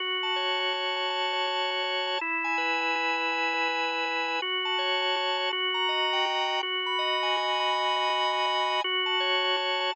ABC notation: X:1
M:3/4
L:1/8
Q:"Swing" 1/4=163
K:F#dor
V:1 name="Drawbar Organ"
F a c a F a | a c F a c a | E g B g E g | g B E g B g |
F a c a F a | F ^a d =g F a | F b d g F b | g d F b d g |
F a c a F a |]